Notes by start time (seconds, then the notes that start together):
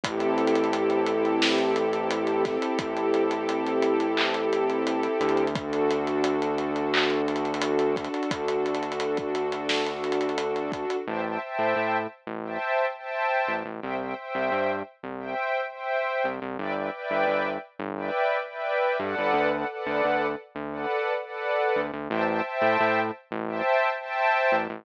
0.03 A1 C4 E4 G4 A4, kick, closed hi-hat
0.20 closed hi-hat
0.38 closed hi-hat
0.47 closed hi-hat
0.55 closed hi-hat
0.64 closed hi-hat
0.73 closed hi-hat
0.90 closed hi-hat
1.06 closed hi-hat
1.25 closed hi-hat
1.42 snare
1.58 closed hi-hat
1.76 closed hi-hat
1.93 closed hi-hat
2.11 closed hi-hat
2.27 closed hi-hat
2.45 kick, snare, closed hi-hat
2.62 closed hi-hat
2.79 A1, kick, closed hi-hat
2.97 closed hi-hat
3.14 closed hi-hat
3.31 closed hi-hat
3.49 closed hi-hat
3.67 closed hi-hat
3.82 closed hi-hat
4.00 closed hi-hat
4.17 clap
4.34 closed hi-hat
4.53 closed hi-hat
4.70 closed hi-hat
4.87 closed hi-hat
5.03 closed hi-hat
5.20 D2, closed hi-hat
5.29 closed hi-hat
5.37 closed hi-hat
5.47 closed hi-hat
5.55 D4 F#4 A4, kick, closed hi-hat
5.73 closed hi-hat
5.91 closed hi-hat
6.07 closed hi-hat
6.24 closed hi-hat
6.42 closed hi-hat
6.58 closed hi-hat
6.76 closed hi-hat
6.94 clap
7.10 closed hi-hat
7.28 closed hi-hat
7.36 closed hi-hat
7.45 closed hi-hat
7.54 closed hi-hat
7.61 closed hi-hat
7.79 closed hi-hat
7.96 kick, closed hi-hat
8.04 closed hi-hat
8.14 closed hi-hat
8.23 closed hi-hat
8.31 D2, kick, closed hi-hat
8.48 closed hi-hat
8.66 closed hi-hat
8.75 closed hi-hat
8.83 closed hi-hat
8.92 closed hi-hat
9.00 closed hi-hat
9.17 kick, closed hi-hat
9.35 closed hi-hat
9.52 closed hi-hat
9.69 snare
9.86 closed hi-hat
10.04 closed hi-hat
10.12 closed hi-hat
10.21 closed hi-hat
10.29 closed hi-hat
10.38 closed hi-hat
10.56 closed hi-hat
10.72 kick, closed hi-hat
10.90 closed hi-hat
11.07 A1 C5 E5 G5 A5
11.26 C5 E5 G5 A5
11.42 C5 E5 G5 A5
11.59 A2
11.76 A2
12.27 A1
12.44 C5 E5 G5 A5
12.98 C5 E5 G5 A5
13.48 A1
13.65 A1
13.82 C2 C5 E5 G5
14.01 C5 E5 G5
14.17 C5 E5 G5
14.35 C2
14.52 G2
15.03 C2
15.19 C5 E5 G5
15.71 C5 E5 G5
16.24 C2
16.42 C2
16.59 G1 B4 D5 E5 G5
16.75 B4 D5 E5 G5
16.93 B4 D5 E5 G5
17.10 G1
17.27 G1
17.79 G1
17.96 B4 D5 E5 G5
18.48 B4 D5 E5 G5
18.99 G2 A4 B4 D5 F#5
19.18 G1
19.34 D2
19.52 A4 B4 D5 F#5
19.71 A4 B4 D5 F#5
19.86 D2
20.04 D2
20.55 D2
20.72 A4 B4 D5 F#5
21.24 A4 B4 D5 F#5
21.76 D2
21.93 D2
22.10 A1 C5 E5 G5 A5
22.27 C5 E5 G5 A5
22.44 C5 E5 G5 A5
22.62 A2
22.80 A2
23.31 A1
23.48 C5 E5 G5 A5
24.00 C5 E5 G5 A5
24.52 A1
24.70 A1